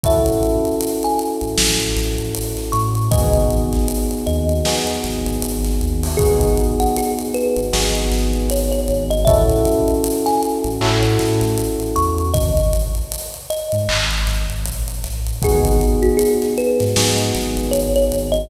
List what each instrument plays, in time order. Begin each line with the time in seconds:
0.03 synth bass 2 A1, electric piano 1 C#4 E4 F#4 A4, kalimba E5, kick, closed hi-hat
0.26 closed hi-hat
0.43 closed hi-hat
0.65 closed hi-hat
0.81 closed hi-hat
1.03 kalimba G#5, closed hi-hat
1.19 closed hi-hat
1.41 synth bass 2 A1, closed hi-hat
1.58 synth bass 2 A1, snare
1.80 closed hi-hat
1.96 synth bass 2 A1, snare, closed hi-hat
2.18 synth bass 2 A1, closed hi-hat
2.35 closed hi-hat
2.57 snare, closed hi-hat
2.72 synth bass 2 A2, kalimba C#6, closed hi-hat
2.95 closed hi-hat
3.11 synth bass 2 G#1, electric piano 1 B3 D#4 F#4 G#4, kalimba D#5, kick, closed hi-hat
3.33 closed hi-hat
3.50 synth bass 2 G#1, closed hi-hat
3.72 snare, closed hi-hat
3.88 closed hi-hat
4.11 closed hi-hat
4.26 synth bass 2 D#2, kalimba D#5, closed hi-hat
4.49 closed hi-hat
4.65 electric piano 1 B3 D#4 F#4 G#4, snare
4.87 closed hi-hat
5.03 synth bass 2 G#1, snare, closed hi-hat
5.26 synth bass 2 G#1, closed hi-hat
5.42 synth bass 2 G#1, closed hi-hat
5.64 snare, closed hi-hat
5.81 synth bass 2 D#2, closed hi-hat
6.03 open hi-hat
6.17 synth bass 2 G#1, electric piano 1 B3 D#4 F#4 G#4, kalimba G#4, kick, closed hi-hat
6.41 closed hi-hat
6.57 closed hi-hat
6.80 kalimba F#5, closed hi-hat
6.96 kalimba G#4, closed hi-hat
7.19 closed hi-hat
7.34 kalimba B4, closed hi-hat
7.56 synth bass 2 G#1, closed hi-hat
7.73 synth bass 2 G#1, electric piano 1 B3 D#4 F#4 G#4, snare
7.95 closed hi-hat
8.11 synth bass 2 G#1, snare, closed hi-hat
8.33 synth bass 2 G#1, closed hi-hat
8.50 kalimba C#5, closed hi-hat
8.72 kalimba C#5, closed hi-hat
8.88 synth bass 2 G#1, closed hi-hat
9.10 kalimba D#5, closed hi-hat
9.25 synth bass 2 A1, electric piano 1 C#4 E4 F#4 A4, kalimba E5, kick, closed hi-hat
9.50 closed hi-hat
9.65 closed hi-hat
9.88 closed hi-hat
10.04 closed hi-hat
10.26 kalimba G#5, snare, closed hi-hat
10.43 closed hi-hat
10.64 synth bass 2 A1, closed hi-hat
10.81 synth bass 2 A2, electric piano 1 C#4 E4 F#4 A4, clap
11.03 closed hi-hat
11.19 synth bass 2 A2, snare, closed hi-hat
11.41 synth bass 2 A1, snare, closed hi-hat
11.58 closed hi-hat
11.80 closed hi-hat
11.96 synth bass 2 E2, kalimba C#6, closed hi-hat
12.18 closed hi-hat
12.33 synth bass 2 G#1, kalimba D#5, kick, closed hi-hat
12.57 closed hi-hat
12.73 closed hi-hat
12.95 closed hi-hat
13.12 closed hi-hat
13.34 closed hi-hat
13.50 kalimba D#5, closed hi-hat
13.72 synth bass 2 G#2, closed hi-hat
13.89 synth bass 2 G#1, clap
14.11 snare, closed hi-hat
14.27 synth bass 2 G#1, snare, closed hi-hat
14.49 synth bass 2 G#1, closed hi-hat
14.65 synth bass 2 A#1, closed hi-hat
14.88 closed hi-hat
15.04 synth bass 2 A1, snare, closed hi-hat
15.27 closed hi-hat
15.42 synth bass 2 G#1, electric piano 1 B3 D#4 F#4 G#4, kalimba G#4, kick, closed hi-hat
15.65 closed hi-hat
15.81 closed hi-hat
16.02 kalimba F#4, closed hi-hat
16.17 kalimba G#4, closed hi-hat
16.42 snare, closed hi-hat
16.58 kalimba B4, closed hi-hat
16.79 synth bass 2 G#2, snare, closed hi-hat
16.96 synth bass 2 G#2, electric piano 1 B3 D#4 F#4 G#4, snare
17.18 closed hi-hat
17.35 synth bass 2 G#1, snare, closed hi-hat
17.57 synth bass 2 G#1, closed hi-hat
17.71 kalimba C#5, closed hi-hat
17.96 kalimba C#5, closed hi-hat
18.12 synth bass 2 G#1, closed hi-hat
18.32 kalimba D#5, closed hi-hat